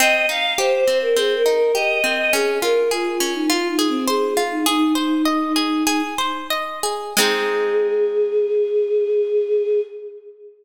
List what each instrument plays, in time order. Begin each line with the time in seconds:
0.00 orchestral harp C4, choir aahs D#5
0.29 orchestral harp D#4, choir aahs F5
0.58 orchestral harp G4, choir aahs C5
0.87 orchestral harp C4
1.02 choir aahs A#4
1.17 orchestral harp C4, choir aahs G#4
1.36 choir aahs A#4
1.46 orchestral harp D#4
1.55 choir aahs A#4
1.75 orchestral harp G4, choir aahs D#5
2.04 orchestral harp C4
2.18 choir aahs D#5
2.33 orchestral harp C#4, choir aahs G#4
2.62 orchestral harp F4, choir aahs A#4
2.91 choir aahs F4, orchestral harp G#4
3.20 orchestral harp C#4
3.35 choir aahs D#4
3.50 choir aahs F4, orchestral harp F4
3.69 choir aahs D#4
3.79 orchestral harp G#4
3.88 choir aahs C4
4.08 choir aahs G#4, orchestral harp C5
4.37 orchestral harp F4
4.51 choir aahs D#4
4.66 choir aahs D#4, orchestral harp G#4
4.95 choir aahs D#4, orchestral harp C5
5.25 orchestral harp D#5
5.56 orchestral harp G#4
5.87 orchestral harp G#4
6.18 orchestral harp C5
6.50 orchestral harp D#5
6.83 orchestral harp G#4
7.17 orchestral harp G#3 C4 D#4, choir aahs G#4